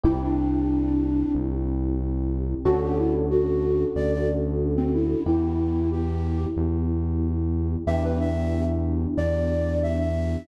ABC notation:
X:1
M:4/4
L:1/16
Q:1/4=92
K:Em
V:1 name="Flute"
E D7 z8 | F G E z F4 d d z3 C E2 | E4 G4 z8 | e B e3 z3 d4 e e3 |]
V:2 name="Electric Piano 1"
[CEG]16 | [^CDFA]16 | [B,EG]16 | [B,DEG]16 |]
V:3 name="Synth Bass 1" clef=bass
C,,8 C,,8 | D,,8 D,,8 | E,,8 E,,8 | E,,8 E,,8 |]